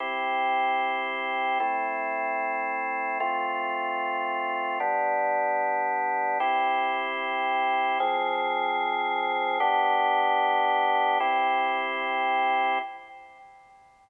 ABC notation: X:1
M:4/4
L:1/8
Q:1/4=150
K:C
V:1 name="Drawbar Organ"
[CEG]8 | [A,CE]8 | [A,CF]8 | [G,B,D]8 |
[CEG]8 | [F,C_A]8 | [B,DG]8 | [CEG]8 |]